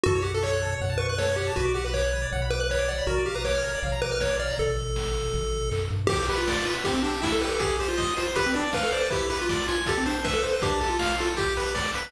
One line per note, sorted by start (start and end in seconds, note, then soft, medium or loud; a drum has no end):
0.04 0.76 F#2 medium
0.04 0.19 F#4 medium
0.04 0.14 A4 medium
0.04 kick medium
0.04 floor tom medium
0.15 0.24 C#5 medium
0.22 0.31 G4 medium
0.22 0.32 F#5 medium
0.22 floor tom soft
0.34 0.43 A4 medium
0.34 0.43 A5 medium
0.42 0.75 C#5 medium
0.42 0.51 C#6 medium
0.42 kick medium
0.42 clap medium
0.53 0.62 F#6 medium
0.62 0.71 A4 medium
0.62 floor tom medium
0.72 0.80 C#5 medium
0.80 1.51 F#2 medium
0.80 0.90 F#5 medium
0.80 kick medium
0.80 floor tom medium
0.90 0.98 A5 medium
0.98 1.07 B4 medium
0.98 1.07 C#6 medium
0.98 floor tom soft
1.09 1.18 B4 medium
1.09 1.18 F#6 medium
1.18 1.27 A4 medium
1.18 1.36 C#5 medium
1.18 kick medium
1.18 snare medium
1.28 1.36 C#5 medium
1.36 1.53 G4 medium
1.36 1.46 F#5 medium
1.36 floor tom soft
1.47 1.56 A5 medium
1.56 2.27 B1 medium
1.56 1.73 F#4 medium
1.56 1.65 B4 medium
1.56 kick medium
1.56 floor tom medium
1.65 1.74 D5 medium
1.74 1.84 G4 medium
1.74 1.83 F#5 medium
1.74 floor tom soft
1.84 1.93 B4 medium
1.84 1.94 B5 medium
1.94 2.27 C#5 medium
1.94 2.02 D6 medium
1.94 kick medium
1.94 clap medium
2.04 2.12 F#6 medium
2.13 2.21 B4 medium
2.13 floor tom medium
2.22 2.30 D5 medium
2.31 3.02 B1 medium
2.31 2.41 F#5 medium
2.31 kick medium
2.31 floor tom medium
2.42 2.50 B5 medium
2.50 2.59 B4 medium
2.50 2.60 D6 medium
2.50 floor tom soft
2.60 2.70 B4 medium
2.60 2.68 F#6 medium
2.69 2.78 B4 medium
2.69 2.89 C#5 medium
2.69 kick medium
2.69 clap medium
2.78 2.87 D5 medium
2.88 3.06 D5 medium
2.88 2.97 F#5 medium
2.88 floor tom medium
2.98 3.07 B5 medium
3.06 3.76 A#1 medium
3.06 3.24 F#4 medium
3.06 3.15 A#4 medium
3.06 kick medium
3.06 floor tom medium
3.17 3.26 D5 medium
3.26 3.35 G4 medium
3.26 3.35 F5 medium
3.26 floor tom soft
3.35 3.44 B4 medium
3.35 3.43 A#5 medium
3.44 3.80 C#5 medium
3.44 3.53 D6 medium
3.44 kick medium
3.44 snare medium
3.54 3.63 F6 medium
3.64 3.72 A#4 medium
3.64 floor tom soft
3.74 3.83 D5 medium
3.83 4.52 A#1 medium
3.83 3.91 F5 medium
3.83 kick medium
3.83 floor tom medium
3.92 4.01 A#5 medium
4.02 4.11 B4 medium
4.02 4.11 D6 medium
4.02 floor tom medium
4.11 4.21 B4 medium
4.11 4.20 F6 medium
4.19 4.28 A#4 medium
4.19 4.37 C#5 medium
4.19 kick medium
4.19 snare medium
4.30 4.38 D5 medium
4.39 4.57 D5 medium
4.39 4.48 F5 medium
4.39 floor tom soft
4.50 4.58 A#5 medium
4.58 5.29 A1 medium
4.58 5.70 A4 medium
4.58 kick medium
4.58 floor tom medium
4.78 floor tom medium
4.96 kick medium
4.96 snare medium
5.14 floor tom medium
5.32 5.71 A1 medium
5.32 kick medium
5.32 floor tom medium
5.53 floor tom medium
5.71 5.89 F#2 medium
5.71 kick medium
5.71 clap medium
5.91 6.08 G2 medium
5.91 floor tom soft
6.07 6.25 G4 medium
6.07 6.27 G4 loud
6.07 kick loud
6.07 crash medium
6.19 closed hi-hat medium
6.28 6.38 G4 medium
6.28 6.46 B4 medium
6.28 open hi-hat medium
6.38 6.65 F4 medium
6.38 closed hi-hat medium
6.47 6.64 D5 loud
6.47 kick medium
6.47 snare loud
6.56 closed hi-hat medium
6.65 6.74 F4 medium
6.65 6.82 B4 medium
6.65 open hi-hat medium
6.75 closed hi-hat medium
6.84 7.03 C4 loud
6.84 6.94 G4 medium
6.84 kick medium
6.84 closed hi-hat medium
6.94 7.03 C4 medium
6.94 closed hi-hat medium
7.03 7.12 D4 medium
7.03 7.21 G4 medium
7.03 open hi-hat medium
7.13 closed hi-hat medium
7.22 7.32 E4 medium
7.22 7.39 E5 medium
7.22 kick medium
7.22 snare loud
7.32 7.41 A4 medium
7.32 closed hi-hat medium
7.41 7.58 G4 medium
7.41 7.50 B4 medium
7.41 open hi-hat medium
7.50 7.60 A4 medium
7.50 closed hi-hat medium
7.59 7.77 G4 medium
7.59 7.77 G#4 loud
7.59 kick medium
7.59 closed hi-hat medium
7.70 closed hi-hat medium
7.79 7.88 G4 medium
7.79 7.97 C5 medium
7.79 open hi-hat medium
7.88 8.14 F4 medium
7.88 closed hi-hat medium
7.97 8.14 D#5 loud
7.97 kick medium
7.97 snare medium
8.07 closed hi-hat medium
8.17 8.27 F4 medium
8.17 8.34 C5 loud
8.17 open hi-hat medium
8.26 closed hi-hat medium
8.35 8.45 G4 medium
8.35 8.53 B4 loud
8.35 kick medium
8.35 closed hi-hat medium
8.46 8.55 C4 medium
8.46 closed hi-hat medium
8.54 8.64 D4 medium
8.54 8.71 D5 medium
8.54 open hi-hat medium
8.65 closed hi-hat medium
8.73 8.83 B4 medium
8.73 8.90 F5 medium
8.73 kick medium
8.73 snare loud
8.83 8.92 A4 medium
8.83 closed hi-hat medium
8.92 9.01 C5 medium
8.92 9.09 D5 medium
8.92 open hi-hat medium
9.01 9.10 B4 medium
9.01 closed hi-hat medium
9.10 9.27 E4 loud
9.10 9.29 G4 medium
9.10 kick medium
9.10 closed hi-hat medium
9.20 closed hi-hat medium
9.30 9.39 G4 medium
9.30 9.47 B4 loud
9.30 open hi-hat medium
9.39 9.67 F4 medium
9.39 closed hi-hat medium
9.49 9.66 D5 medium
9.49 kick medium
9.49 snare medium
9.59 closed hi-hat medium
9.68 9.78 F4 medium
9.68 9.85 G#5 medium
9.68 open hi-hat medium
9.78 closed hi-hat medium
9.86 9.98 G4 medium
9.86 10.04 A4 loud
9.86 kick medium
9.86 closed hi-hat medium
9.97 10.07 C4 medium
9.97 closed hi-hat medium
10.06 10.16 D4 medium
10.06 10.23 C5 medium
10.06 open hi-hat medium
10.16 closed hi-hat medium
10.24 10.33 B4 medium
10.24 10.41 E5 loud
10.24 kick medium
10.24 snare medium
10.34 10.43 A4 medium
10.34 closed hi-hat medium
10.43 10.51 C5 medium
10.43 10.61 C5 medium
10.43 open hi-hat medium
10.53 10.62 B4 medium
10.53 closed hi-hat medium
10.62 10.79 D4 loud
10.62 10.80 G4 medium
10.62 kick loud
10.62 closed hi-hat medium
10.71 closed hi-hat medium
10.80 10.89 G4 medium
10.80 10.98 A4 medium
10.80 open hi-hat medium
10.89 11.16 F4 medium
10.89 closed hi-hat medium
10.99 11.16 F5 medium
10.99 kick medium
10.99 snare loud
11.10 closed hi-hat medium
11.18 11.29 F4 medium
11.18 11.35 A4 medium
11.18 open hi-hat medium
11.28 closed hi-hat medium
11.37 11.54 G4 loud
11.37 11.75 G4 medium
11.37 kick medium
11.37 closed hi-hat medium
11.48 closed hi-hat medium
11.57 11.74 B4 loud
11.57 open hi-hat medium
11.66 closed hi-hat medium
11.75 11.92 D5 medium
11.75 kick medium
11.75 snare medium
11.85 closed hi-hat medium
11.94 12.12 B4 loud
11.94 open hi-hat medium
12.03 closed hi-hat medium